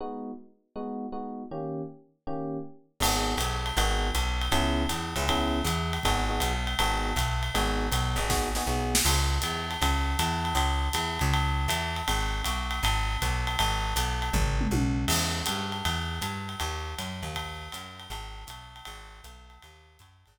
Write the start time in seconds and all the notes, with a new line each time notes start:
0.01 G#3 B3 D#4 F#4
0.76 G#3 B3 D#4 F#4
1.12 G#3 B3 D#4 F#4
1.51 D#3 A#3 C#4 G4
2.27 D#3 A#3 C#4 G4
3.00 G#1 B3 D#4 F#4 G#4, crash, ride
3.37 B1, hi-hat pedal, ride
3.66 ride
3.77 G#1 B3 D#4 F#4 G#4, ride
4.15 B1, hi-hat pedal, ride
4.42 ride
4.52 C#2 B3 C#4 E4 G#4, ride
4.89 E2, hi-hat pedal, ride
5.16 C#2 B3 C#4 E4 G#4, ride
5.28 B3 C#4 E4 G#4, kick, ride
5.64 E2, hi-hat pedal, ride
5.93 ride
6.03 G#1 B3 D#4 F#4 G#4, kick, ride
6.29 B3 D#4 F#4 G#4
6.40 B1, hi-hat pedal, ride
6.67 ride
6.79 G#1 B3 D#4 F#4 G#4, ride
7.16 B1, kick, hi-hat pedal, ride
7.43 ride
7.54 G#1 B3 D#4 F#4 G#4, ride
7.92 B1, hi-hat pedal, ride
8.16 G#1 B3 D#4 F#4 G#4, ride
8.29 B3 D#4 F#4 G#4, kick, snare
8.55 B3 D#4 F#4 G#4, snare
8.67 B1 B3 D#4 F#4 G#4
8.95 snare
9.05 C#2, crash, ride
9.42 E2, hi-hat pedal, ride
9.71 ride
9.81 C#2, kick, ride
10.19 E2, hi-hat pedal, ride
10.45 ride
10.55 C#2, ride
10.93 E2, hi-hat pedal, ride
11.19 C#2, ride
11.34 ride
11.68 E2, hi-hat pedal, ride
11.96 ride
12.08 G#1, ride
12.44 B1, hi-hat pedal, ride
12.71 ride
12.83 G#1, ride
13.22 B1, kick, hi-hat pedal, ride
13.47 ride
13.59 G#1, ride
13.96 B1, hi-hat pedal, ride
14.22 ride
14.33 G#1, kick, floor tom
14.61 mid tom
14.71 B1, high tom
15.08 E2, crash, ride
15.46 G2, hi-hat pedal, ride
15.72 ride
15.85 E2, ride
16.21 G2, hi-hat pedal, ride
16.49 ride
16.60 D#2, ride
16.99 F#2, hi-hat pedal, ride
17.23 D#2, ride
17.35 kick, ride
17.72 F#2, hi-hat pedal, ride
18.00 ride
18.10 G#1, ride
18.47 B1, hi-hat pedal, ride
18.76 ride
18.85 G#1, ride
19.24 B1, hi-hat pedal, ride
19.50 ride
19.62 D#2, ride
19.99 F#2, kick, hi-hat pedal, ride
20.26 G#1, ride